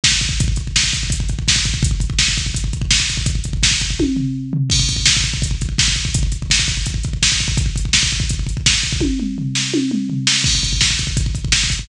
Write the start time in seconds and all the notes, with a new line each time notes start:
0.04 kick, snare
0.12 kick
0.21 kick, closed hi-hat
0.29 kick
0.40 kick, closed hi-hat
0.48 kick
0.56 kick, closed hi-hat
0.67 kick
0.76 kick, snare
0.84 kick
0.93 kick, closed hi-hat
1.03 kick
1.10 kick, closed hi-hat
1.20 kick
1.29 kick, closed hi-hat
1.39 kick
1.48 kick, snare
1.56 kick
1.65 kick, closed hi-hat
1.74 kick
1.83 kick, closed hi-hat
1.91 kick
2.00 kick, closed hi-hat
2.10 kick
2.19 kick, snare
2.28 kick
2.37 kick, closed hi-hat
2.46 kick
2.54 kick, closed hi-hat
2.64 kick
2.73 kick, closed hi-hat
2.82 kick
2.91 kick, snare
3.00 kick
3.09 kick, closed hi-hat
3.17 kick
3.26 kick, closed hi-hat
3.35 kick
3.44 kick, closed hi-hat
3.53 kick
3.63 kick, snare
3.71 kick
3.80 kick, closed hi-hat
3.90 kick
3.99 kick, high tom
4.16 floor tom
4.53 floor tom
4.70 kick, crash
4.79 kick
4.89 kick, closed hi-hat
4.96 kick
5.06 kick, snare
5.17 kick
5.24 kick, closed hi-hat
5.34 kick
5.42 kick, closed hi-hat
5.51 kick
5.61 kick, closed hi-hat
5.69 kick
5.78 kick, snare
5.88 kick
5.96 kick, closed hi-hat
6.05 kick
6.14 kick, closed hi-hat
6.23 kick
6.32 kick, closed hi-hat
6.42 kick
6.50 kick, snare
6.59 kick
6.67 kick, closed hi-hat
6.77 kick
6.86 kick, closed hi-hat
6.94 kick
7.03 kick, closed hi-hat
7.13 kick
7.23 kick, snare
7.32 kick
7.40 kick, closed hi-hat
7.48 kick
7.57 kick, closed hi-hat
7.66 kick
7.76 kick, closed hi-hat
7.85 kick
7.93 kick, snare
8.03 kick
8.11 kick, closed hi-hat
8.20 kick
8.29 kick, closed hi-hat
8.39 kick
8.47 kick, closed hi-hat
8.57 kick
8.66 kick, snare
8.74 kick
8.83 kick, closed hi-hat
8.93 kick
9.01 kick, high tom
9.20 mid tom
9.38 floor tom
9.55 snare
9.74 high tom
9.91 mid tom
10.10 floor tom
10.27 snare
10.44 kick, crash
10.55 kick
10.63 kick, closed hi-hat
10.73 kick
10.81 kick, snare
10.90 kick
10.99 kick, closed hi-hat
11.07 kick
11.17 kick, closed hi-hat
11.26 kick
11.35 kick, closed hi-hat
11.45 kick
11.52 kick, snare
11.64 kick
11.70 kick, closed hi-hat
11.79 kick